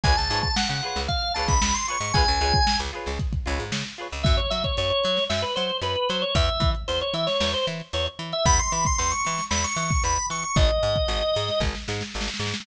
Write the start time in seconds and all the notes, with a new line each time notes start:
0.04 C#2 F4 G#4 B4 C#5 G#5, kick, closed hi-hat
0.17 C#2 A5, closed hi-hat
0.30 G#2 F4 G#4 B4 C#5, snare, closed hi-hat
0.43 A5, kick, closed hi-hat
0.56 F#5, snare
0.69 C#3 F#5, closed hi-hat
0.83 F4 G#4 B4 C#5, closed hi-hat
0.96 C#2, snare, closed hi-hat
1.08 F5, kick, closed hi-hat
1.22 closed hi-hat
1.34 C#2 F4 G#4 B4 A5, closed hi-hat
1.39 C#5
1.48 C#2 B5, kick, closed hi-hat
1.62 C#2 B5, snare
1.74 C6, closed hi-hat
1.88 F4 G#4 B4 C#5 C#6, closed hi-hat
2.00 G#2, closed hi-hat
2.14 C#2 F4 G#4 B4 G#5, kick, closed hi-hat
2.18 C#5
2.27 C#2, closed hi-hat
2.40 C#2 F4 G#4 B4 C#5, closed hi-hat
2.54 kick, closed hi-hat
2.67 snare
2.79 C#2, closed hi-hat
2.93 F4 G#4 B4 C#5, closed hi-hat
3.06 C#2, snare, closed hi-hat
3.19 kick, closed hi-hat
3.33 kick, closed hi-hat
3.46 C#2 F4 G#4 B4 C#5, closed hi-hat
3.59 G#2, snare, closed hi-hat
3.72 C#3, snare
3.85 closed hi-hat
3.98 F4 G#4 B4 C#5, closed hi-hat
4.12 C#2, open hi-hat
4.23 F#2 E5, kick, closed hi-hat
4.37 C#5, closed hi-hat
4.50 F#3 E5, closed hi-hat
4.64 C#5, kick, closed hi-hat
4.77 F#2 C#5, closed hi-hat
4.90 C#5, closed hi-hat
5.04 F#3, closed hi-hat
5.17 snare, closed hi-hat
5.29 F#2 E5, snare
5.42 B4, closed hi-hat
5.56 F#3 C5, closed hi-hat
5.69 closed hi-hat
5.81 F#2 B4, closed hi-hat
5.96 closed hi-hat
6.09 F#3 C5, closed hi-hat
6.22 C#5, closed hi-hat
6.35 E2 E5, kick, closed hi-hat
6.48 closed hi-hat
6.60 E3, kick, closed hi-hat
6.75 closed hi-hat
6.88 E2 C5, closed hi-hat
7.01 C#5, closed hi-hat
7.14 E3 E5, closed hi-hat
7.27 C#5, snare, closed hi-hat
7.40 E2, snare
7.54 C5, closed hi-hat
7.67 E3, closed hi-hat
7.80 closed hi-hat
7.93 E2 C#5, closed hi-hat
8.06 closed hi-hat
8.19 E3, closed hi-hat
8.32 E5, closed hi-hat
8.45 E2 B5, kick, closed hi-hat
8.59 C6, closed hi-hat
8.72 E3 B5, closed hi-hat
8.85 C6, kick, closed hi-hat
8.98 E2 C6, closed hi-hat
9.11 C#6, snare, closed hi-hat
9.25 E3, snare, closed hi-hat
9.38 snare, closed hi-hat
9.50 E2 B5, snare
9.64 C#6, snare, closed hi-hat
9.76 E3 C#6, closed hi-hat
9.90 kick, snare, closed hi-hat
10.04 E2 B5, closed hi-hat
10.17 closed hi-hat
10.30 E3 C#6, closed hi-hat
10.43 C#6, closed hi-hat
10.56 G#1 D#5, kick, closed hi-hat
10.69 closed hi-hat
10.83 G#2, closed hi-hat
10.96 kick, closed hi-hat
11.08 G#1, closed hi-hat
11.22 snare, closed hi-hat
11.35 G#2, snare, closed hi-hat
11.48 snare, closed hi-hat
11.60 G#1, kick, snare
11.75 snare
11.88 G#2, snare
12.01 snare
12.14 G#1, snare
12.21 snare
12.27 snare
12.34 snare
12.39 G#2, snare
12.47 snare
12.54 snare
12.60 snare